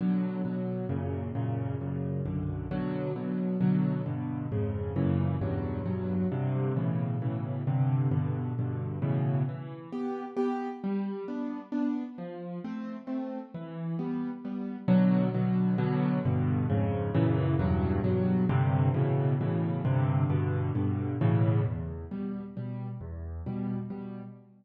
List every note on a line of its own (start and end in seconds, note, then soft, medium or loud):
0.01 0.41 B2 medium
0.01 0.41 D3 medium
0.01 0.41 F#3 medium
0.45 0.85 B2 medium
0.45 0.85 D3 medium
0.45 0.85 F#3 medium
0.89 1.30 F#2 medium
0.89 1.30 A#2 medium
0.89 1.30 C#3 medium
1.35 1.76 F#2 medium
1.35 1.76 A#2 medium
1.35 1.76 C#3 medium
1.81 2.22 F#2 medium
1.81 2.22 A#2 medium
1.81 2.22 C#3 medium
2.26 2.66 B1 medium
2.26 2.66 F#2 medium
2.26 2.66 D3 medium
2.71 3.12 B2 medium
2.71 3.12 D3 medium
2.71 3.12 F#3 medium
3.16 3.56 B2 medium
3.16 3.56 D3 medium
3.16 3.56 F#3 medium
3.61 4.01 B2 medium
3.61 4.01 D3 medium
3.61 4.01 F#3 medium
4.06 4.47 G2 medium
4.06 4.47 B2 medium
4.06 4.47 D3 medium
4.52 4.92 F2 medium
4.52 4.92 G#2 medium
4.52 4.92 C#3 medium
4.96 5.37 F#2 medium
4.96 5.37 A#2 medium
4.96 5.37 C#3 medium
4.96 5.37 E3 medium
5.41 5.82 E2 medium
5.41 5.82 G2 medium
5.41 5.82 B2 medium
5.41 5.82 F#3 medium
5.86 6.26 E2 medium
5.86 6.26 G2 medium
5.86 6.26 B2 medium
5.86 6.26 F#3 medium
6.32 6.72 G2 medium
6.32 6.72 C3 medium
6.32 6.72 D3 medium
6.76 7.17 A2 medium
6.76 7.17 B2 medium
6.76 7.17 C#3 medium
6.76 7.17 E3 medium
7.22 7.63 A2 medium
7.22 7.63 B2 medium
7.22 7.63 C#3 medium
7.22 7.63 E3 medium
7.67 8.08 G2 medium
7.67 8.08 C3 medium
7.67 8.08 D3 medium
8.11 8.52 G2 medium
8.11 8.52 B2 medium
8.11 8.52 D3 medium
8.59 8.99 G2 medium
8.59 8.99 B2 medium
8.59 8.99 D3 medium
9.02 9.43 A2 medium
9.02 9.43 B2 medium
9.02 9.43 C#3 medium
9.02 9.43 E3 medium
9.49 9.89 E3 medium
9.92 10.24 B3 medium
9.92 10.24 G4 medium
10.37 10.68 B3 medium
10.37 10.68 G4 medium
10.84 11.24 G3 medium
11.28 11.60 B3 medium
11.28 11.60 D4 medium
11.72 12.04 B3 medium
11.72 12.04 D4 medium
12.18 12.59 F3 medium
12.64 12.96 A3 medium
12.64 12.96 C4 medium
13.07 13.39 A3 medium
13.07 13.39 C4 medium
13.54 13.95 E3 medium
13.99 14.30 G3 medium
13.99 14.30 B3 medium
14.45 14.76 G3 medium
14.45 14.76 B3 medium
14.88 15.29 B2 loud
14.88 15.29 D3 medium
14.88 15.29 F#3 loud
15.34 15.75 B2 medium
15.34 15.75 D3 medium
15.34 15.75 F#3 medium
15.78 16.19 B2 loud
15.78 16.19 D3 medium
15.78 16.19 F#3 loud
16.25 16.66 G2 medium
16.25 16.66 B2 loud
16.25 16.66 D3 medium
16.70 17.10 F2 medium
16.70 17.10 G#2 medium
16.70 17.10 C#3 loud
17.15 17.55 F#2 loud
17.15 17.55 A#2 loud
17.15 17.55 C#3 loud
17.15 17.55 E3 loud
17.59 18.00 E2 loud
17.59 18.00 G2 loud
17.59 18.00 B2 medium
17.59 18.00 F#3 medium
18.04 18.45 E2 medium
18.04 18.45 G2 medium
18.04 18.45 B2 medium
18.04 18.45 F#3 medium
18.49 18.90 G2 loud
18.49 18.90 C3 loud
18.49 18.90 D3 loud
18.94 19.35 A2 medium
18.94 19.35 B2 medium
18.94 19.35 C#3 medium
18.94 19.35 E3 medium
19.41 19.81 A2 medium
19.41 19.81 B2 medium
19.41 19.81 C#3 medium
19.41 19.81 E3 medium
19.85 20.25 G2 loud
19.85 20.25 C3 loud
19.85 20.25 D3 loud
20.30 20.70 G2 medium
20.30 20.70 B2 loud
20.30 20.70 D3 medium
20.75 21.16 G2 medium
20.75 21.16 B2 medium
20.75 21.16 D3 medium
21.21 21.62 A2 loud
21.21 21.62 B2 loud
21.21 21.62 C#3 loud
21.21 21.62 E3 medium
21.64 22.05 E2 medium
22.11 22.43 B2 medium
22.11 22.43 G3 medium
22.57 22.88 B2 medium
22.57 22.88 G3 medium
23.01 23.41 E2 medium
23.46 23.78 B2 medium
23.46 23.78 G3 medium
23.90 24.22 B2 medium
23.90 24.22 G3 medium